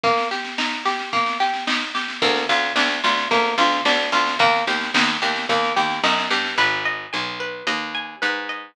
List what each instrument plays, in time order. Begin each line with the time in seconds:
0.03 acoustic guitar (steel) A#3, kick, snare
0.17 snare
0.31 acoustic guitar (steel) G4, snare
0.44 snare
0.58 acoustic guitar (steel) D#4, snare
0.72 snare
0.85 acoustic guitar (steel) G4, snare
0.99 snare
1.13 acoustic guitar (steel) A#3, kick, snare
1.26 snare
1.40 acoustic guitar (steel) G4, snare
1.54 snare
1.67 acoustic guitar (steel) D#4, snare
1.81 snare
1.95 acoustic guitar (steel) G4, snare
2.08 snare
2.22 harpsichord D2, acoustic guitar (steel) A#3, kick, snare
2.36 snare
2.49 harpsichord D2, acoustic guitar (steel) F4, snare
2.63 snare
2.76 harpsichord D2, acoustic guitar (steel) D4, snare
2.90 snare
3.04 harpsichord D2, acoustic guitar (steel) F4, snare
3.17 snare
3.31 harpsichord D2, acoustic guitar (steel) A#3, kick, snare
3.45 snare
3.58 harpsichord D2, acoustic guitar (steel) F4, snare
3.72 snare
3.85 harpsichord D2, acoustic guitar (steel) D4, snare
3.99 snare
4.12 harpsichord D2, acoustic guitar (steel) F4, snare
4.26 snare
4.39 harpsichord D#2, acoustic guitar (steel) A#3, kick, snare
4.53 snare
4.67 harpsichord D#2, acoustic guitar (steel) G4, snare
4.81 snare
4.94 harpsichord D#2, acoustic guitar (steel) D#4, snare
5.08 snare
5.22 harpsichord D#2, acoustic guitar (steel) G4, snare
5.36 snare
5.49 harpsichord D#2, acoustic guitar (steel) A#3, kick, snare
5.63 snare
5.76 harpsichord D#2, acoustic guitar (steel) G4, snare
5.90 snare
6.03 harpsichord F#2, acoustic guitar (steel) D#4, snare
6.17 snare
6.30 harpsichord G2, acoustic guitar (steel) G4, snare
6.45 snare
6.58 harpsichord G#1, acoustic guitar (steel) B4
6.85 acoustic guitar (steel) D#5
7.13 harpsichord B1, acoustic guitar (steel) G#5
7.40 acoustic guitar (steel) B4
7.67 harpsichord D#2, acoustic guitar (steel) D#5
7.95 acoustic guitar (steel) G#5
8.22 harpsichord G#2, acoustic guitar (steel) B4
8.49 acoustic guitar (steel) D#5